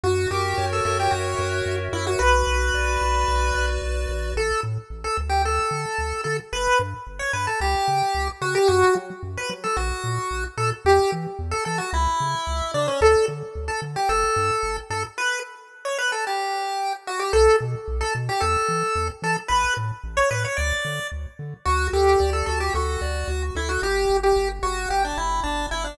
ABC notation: X:1
M:4/4
L:1/16
Q:1/4=111
K:Bm
V:1 name="Lead 1 (square)"
F2 G3 A A G F6 E F | B12 z4 | [K:D] A2 z3 A z G A6 A z | B2 z3 c B A G6 F G |
F2 z3 B z A F6 A z | G2 z3 A A F E6 D C | A2 z3 A z G A6 A z | B2 z3 c B A G6 F G |
A2 z3 A z G A6 A z | B2 z3 c B c d4 z4 | [K:Bm] F2 G3 A A G F6 E F | G3 G2 z F2 G D E2 D2 E D |]
V:2 name="Lead 1 (square)"
F2 ^A2 c2 e2 F2 A2 c2 e2 | F2 B2 d2 F2 B2 d2 F2 B2 | [K:D] z16 | z16 |
z16 | z16 | z16 | z16 |
z16 | z16 | [K:Bm] F2 A2 d2 F2 A2 d2 F2 A2 | z16 |]
V:3 name="Synth Bass 1" clef=bass
F,,2 F,,2 F,,2 F,,2 F,,2 F,,2 F,,2 F,,2 | B,,,2 B,,,2 B,,,2 B,,,2 B,,,2 B,,,2 B,,,2 ^A,,,2 | [K:D] A,,,2 A,,2 A,,,2 D,,4 D,2 D,,2 D,2 | G,,,2 G,,2 G,,,2 G,,2 C,,2 C,2 C,,2 C,2 |
F,,2 F,2 F,,2 F,2 _B,,,2 _B,,2 B,,,2 B,,2 | E,,2 E,2 E,,2 E,2 C,,2 C,2 C,,2 C,2 | D,,2 D,2 D,,2 D,2 G,,,2 G,,2 G,,,2 G,,2 | z16 |
B,,,2 B,,2 B,,,2 B,,2 E,,2 E,2 E,,2 E,2 | A,,,2 A,,2 A,,,2 A,,2 D,,2 D,2 D,,2 D,2 | [K:Bm] D,,2 D,,2 D,,2 D,,2 D,,2 D,,2 D,,2 D,,2 | G,,,2 G,,,2 G,,,2 G,,,2 G,,,2 G,,,2 G,,,2 G,,,2 |]